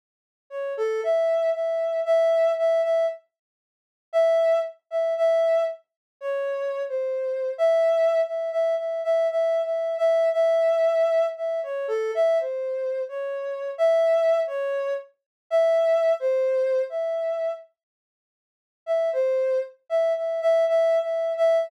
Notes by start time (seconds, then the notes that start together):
0.50 C#5
0.77 A4
1.04 E5
1.54 E5
2.06 E5
2.58 E5
2.83 E5
4.13 E5
4.91 E5
5.17 E5
6.21 C#5
6.89 C5
7.58 E5
8.26 E5
8.52 E5
8.78 E5
9.04 E5
9.30 E5
9.64 E5
9.98 E5
10.33 E5
11.37 E5
11.63 C#5
11.88 A4
12.15 E5
12.40 C5
13.09 C#5
13.78 E5
14.47 C#5
15.50 E5
16.20 C5
16.90 E5
18.86 E5
19.13 C5
19.89 E5
20.17 E5
20.42 E5
20.68 E5
21.02 E5
21.37 E5